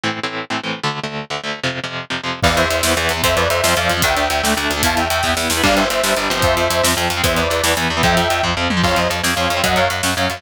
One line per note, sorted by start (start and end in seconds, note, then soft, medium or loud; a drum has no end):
0.04 0.20 A2 medium
0.04 0.20 E3 medium
0.04 0.20 C4 medium
0.23 0.45 A2 medium
0.23 0.45 E3 medium
0.23 0.45 C4 medium
0.50 0.61 A2 medium
0.50 0.61 E3 medium
0.50 0.61 C4 medium
0.64 0.80 A2 medium
0.64 0.80 E3 medium
0.64 0.80 C4 medium
0.84 1.00 D2 medium
0.84 1.00 D3 medium
0.84 1.00 A3 medium
1.04 1.25 D2 soft
1.04 1.25 D3 medium
1.04 1.25 A3 medium
1.30 1.41 D2 medium
1.30 1.41 D3 medium
1.30 1.41 A3 medium
1.44 1.60 D2 medium
1.44 1.60 D3 medium
1.44 1.60 A3 medium
1.64 1.80 F2 medium
1.64 1.80 C3 medium
1.64 1.80 F3 medium
1.84 2.05 F2 medium
1.84 2.05 C3 medium
1.84 2.05 F3 medium
2.10 2.21 F2 medium
2.10 2.21 C3 medium
2.10 2.21 F3 medium
2.24 2.40 F2 medium
2.24 2.40 C3 medium
2.24 2.40 F3 medium
2.43 2.55 E2 medium
2.43 2.65 E3 loud
2.43 2.65 B3 medium
2.43 2.55 D5 loud
2.43 2.55 F5 loud
2.43 kick loud
2.43 crash medium
2.57 2.68 E2 medium
2.57 2.69 C5 medium
2.57 2.69 E5 loud
2.57 closed hi-hat medium
2.70 2.82 E2 medium
2.70 2.93 C5 medium
2.70 2.93 E5 medium
2.70 closed hi-hat medium
2.83 2.95 E2 medium
2.83 2.94 E3 medium
2.83 2.94 B3 medium
2.83 snare loud
2.97 3.08 E2 medium
2.97 3.13 E3 medium
2.97 3.13 B3 medium
2.97 closed hi-hat medium
3.09 3.22 E2 medium
3.09 closed hi-hat medium
3.17 3.22 E3 medium
3.17 3.22 B3 medium
3.23 3.35 F2 medium
3.23 3.45 F3 loud
3.23 3.45 C4 medium
3.23 3.37 C5 loud
3.23 3.37 E5 loud
3.23 kick loud
3.23 closed hi-hat loud
3.36 3.48 F2 medium
3.36 3.48 B4 medium
3.36 3.48 D5 loud
3.36 closed hi-hat medium
3.49 3.62 F2 medium
3.49 3.75 C5 loud
3.49 3.75 E5 loud
3.49 closed hi-hat medium
3.63 3.75 F2 medium
3.63 3.74 F3 medium
3.63 3.74 C4 medium
3.63 snare loud
3.77 3.88 F2 medium
3.77 3.93 F3 medium
3.77 3.93 C4 medium
3.77 3.89 D5 medium
3.77 3.89 F5 medium
3.77 closed hi-hat medium
3.90 4.02 F2 medium
3.90 closed hi-hat medium
3.97 4.02 F3 medium
3.97 4.02 C4 medium
4.02 4.15 D2 medium
4.02 4.25 A3 medium
4.02 4.25 D4 loud
4.02 4.53 E5 medium
4.02 4.53 G5 loud
4.02 kick loud
4.02 closed hi-hat loud
4.17 4.28 D2 medium
4.17 closed hi-hat medium
4.30 4.42 D2 medium
4.30 closed hi-hat medium
4.44 4.55 D2 medium
4.44 4.54 A3 medium
4.44 4.54 D4 medium
4.44 snare medium
4.57 4.68 D2 medium
4.57 4.73 A3 medium
4.57 4.73 D4 medium
4.57 closed hi-hat medium
4.70 4.82 D2 medium
4.70 closed hi-hat medium
4.77 4.82 A3 medium
4.77 4.82 D4 medium
4.83 4.95 E2 loud
4.83 5.05 B3 medium
4.83 5.05 E4 loud
4.83 4.98 F5 medium
4.83 4.98 A5 loud
4.83 kick medium
4.83 closed hi-hat loud
4.97 5.08 E2 medium
4.97 5.08 E5 medium
4.97 5.08 G5 medium
4.97 closed hi-hat medium
5.10 5.22 E2 medium
5.10 5.32 E5 medium
5.10 5.32 G5 loud
5.10 closed hi-hat medium
5.23 5.35 E2 medium
5.23 5.34 B3 medium
5.23 5.34 E4 medium
5.23 kick medium
5.23 snare medium
5.37 5.48 E2 medium
5.37 5.53 B3 medium
5.37 5.53 E4 medium
5.37 snare medium
5.50 5.62 E2 medium
5.50 snare loud
5.57 5.62 B3 medium
5.57 5.62 E4 medium
5.63 5.75 G1 medium
5.63 5.85 G3 loud
5.63 5.85 D4 loud
5.63 5.75 D5 loud
5.63 5.75 F5 loud
5.63 kick medium
5.63 crash loud
5.76 5.88 G1 medium
5.76 5.88 C5 medium
5.76 5.88 E5 medium
5.76 closed hi-hat medium
5.90 6.02 G1 medium
5.90 6.14 C5 medium
5.90 6.14 E5 loud
5.90 closed hi-hat medium
6.04 6.15 G1 medium
6.04 6.14 G3 medium
6.04 6.14 D4 medium
6.04 snare loud
6.17 6.28 G1 medium
6.17 6.30 G3 medium
6.17 6.30 D4 medium
6.17 closed hi-hat medium
6.30 6.42 G1 medium
6.30 6.65 F3 loud
6.30 6.65 C4 loud
6.30 closed hi-hat medium
6.42 6.55 F2 medium
6.42 6.88 C5 loud
6.42 6.88 E5 loud
6.42 kick loud
6.42 closed hi-hat medium
6.57 6.68 F2 medium
6.57 closed hi-hat medium
6.70 6.82 F2 medium
6.70 closed hi-hat medium
6.84 6.95 F2 medium
6.84 6.94 F3 medium
6.84 6.94 C4 medium
6.84 snare loud
6.97 7.08 F2 medium
6.97 7.13 F3 medium
6.97 7.13 C4 medium
6.97 closed hi-hat medium
7.10 7.22 F2 medium
7.10 closed hi-hat medium
7.17 7.22 F3 medium
7.17 7.22 C4 medium
7.24 7.35 E2 medium
7.24 7.45 E3 loud
7.24 7.45 B3 loud
7.24 7.36 C5 medium
7.24 7.36 E5 loud
7.24 kick loud
7.24 closed hi-hat loud
7.37 7.48 E2 medium
7.37 7.48 B4 medium
7.37 7.48 D5 medium
7.37 closed hi-hat medium
7.49 7.62 E2 medium
7.49 7.72 B4 medium
7.49 7.72 D5 medium
7.49 closed hi-hat medium
7.63 7.75 E2 medium
7.63 7.74 E3 medium
7.63 7.74 B3 medium
7.63 snare loud
7.77 7.88 E2 medium
7.77 7.93 E3 medium
7.77 7.93 B3 medium
7.77 closed hi-hat medium
7.90 8.02 E2 medium
7.97 8.02 E3 medium
7.97 8.02 B3 medium
8.03 8.15 F2 loud
8.03 8.25 F3 loud
8.03 8.25 C4 loud
8.03 8.42 E5 loud
8.03 8.42 G5 loud
8.03 kick loud
8.03 closed hi-hat medium
8.17 8.28 F2 medium
8.17 closed hi-hat medium
8.30 8.42 F2 medium
8.30 closed hi-hat medium
8.43 8.55 F2 medium
8.43 8.54 F3 medium
8.43 8.54 C4 medium
8.43 kick medium
8.57 8.68 F2 medium
8.57 8.73 F3 medium
8.57 8.73 C4 medium
8.70 8.82 F2 medium
8.70 mid tom loud
8.77 8.82 F3 medium
8.77 8.82 C4 medium
8.83 8.95 F2 medium
8.83 9.05 F3 medium
8.83 9.05 C4 medium
8.83 8.97 C#5 medium
8.83 8.97 F5 loud
8.83 kick medium
8.83 crash medium
8.96 9.08 F2 medium
8.96 9.10 C5 medium
8.96 9.10 D#5 medium
8.96 closed hi-hat medium
9.10 9.22 F2 medium
9.10 closed hi-hat medium
9.24 9.35 F2 medium
9.24 9.34 F3 medium
9.24 9.34 C4 medium
9.24 snare medium
9.35 9.48 F2 medium
9.35 9.53 F3 medium
9.35 9.53 C4 medium
9.35 9.60 C#5 medium
9.35 9.60 F5 medium
9.35 closed hi-hat medium
9.50 9.62 F2 medium
9.50 closed hi-hat medium
9.57 9.62 F3 medium
9.57 9.62 C4 medium
9.64 9.75 F#2 medium
9.64 9.85 F#3 medium
9.64 9.85 C#4 medium
9.64 9.76 D#5 medium
9.64 9.76 F#5 loud
9.64 kick medium
9.64 closed hi-hat medium
9.76 9.88 F#2 medium
9.76 9.90 C#5 loud
9.76 9.90 F5 loud
9.76 closed hi-hat medium
9.90 10.02 F#2 medium
9.90 closed hi-hat medium
10.03 10.15 F#2 medium
10.03 10.14 F#3 medium
10.03 10.14 C#4 medium
10.03 snare medium
10.17 10.28 F#2 medium
10.17 10.33 F#3 medium
10.17 10.33 C#4 medium
10.17 10.40 C#5 medium
10.17 10.40 F5 medium
10.17 closed hi-hat medium
10.30 10.42 F#2 medium
10.30 closed hi-hat medium
10.37 10.42 F#3 medium
10.37 10.42 C#4 medium